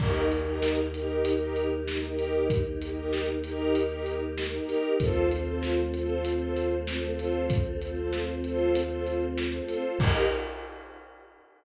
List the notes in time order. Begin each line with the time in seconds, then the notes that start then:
0.00 D#2 A#3 D#4 G4 A#4, kick, crash
0.31 D#4 G4 A#4, closed hi-hat
0.42 D#4 G4 A#4
0.62 snare
0.94 D#4 G4 A#4, closed hi-hat
1.25 closed hi-hat
1.35 D#4 G4 A#4
1.56 closed hi-hat
1.88 snare
1.98 D#4 G4 A#4
2.08 D#4 G4 A#4
2.19 closed hi-hat
2.50 kick, closed hi-hat
2.81 D#4 G4 A#4, closed hi-hat
2.92 D#4 G4 A#4
3.13 snare
3.44 D#4 G4 A#4, closed hi-hat
3.75 closed hi-hat
3.85 D#4 G4 A#4
4.06 closed hi-hat
4.38 snare
4.48 D#4 G4 A#4
4.58 D#4 G4 A#4
4.69 closed hi-hat
5.00 D#2 A3 C4 F4 A4 C5, kick, closed hi-hat
5.31 F4 A4 C5, closed hi-hat
5.42 F4 A4 C5
5.63 snare
5.94 F4 A4 C5, closed hi-hat
6.25 closed hi-hat
6.35 F4 A4 C5
6.56 closed hi-hat
6.87 snare
6.98 F4 A4 C5
7.09 F4 A4 C5
7.19 closed hi-hat
7.50 kick, closed hi-hat
7.81 F4 A4 C5, closed hi-hat
7.92 F4 A4 C5
8.13 snare
8.44 F4 A4 C5, closed hi-hat
8.75 closed hi-hat
8.85 F4 A4 C5
9.06 closed hi-hat
9.38 snare
9.48 F4 A4 C5
9.59 F4 A4 C5
9.68 closed hi-hat
9.99 D#2 A#3 D#4 G4 A#4, kick, crash